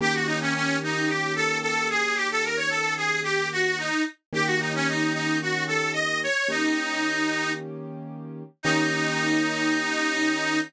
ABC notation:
X:1
M:4/4
L:1/16
Q:1/4=111
K:Eb
V:1 name="Harmonica"
G _G E _D D2 E2 =G2 =A2 A2 _A2 | G =A B _d A2 _A2 G2 _G2 E2 z2 | G _G E _D E2 E2 G2 =A2 e2 _d2 | E8 z8 |
E16 |]
V:2 name="Acoustic Grand Piano"
[E,B,_DG]16- | [E,B,_DG]16 | [E,B,_DG]16 | [E,B,_DG]16 |
[E,B,_DG]16 |]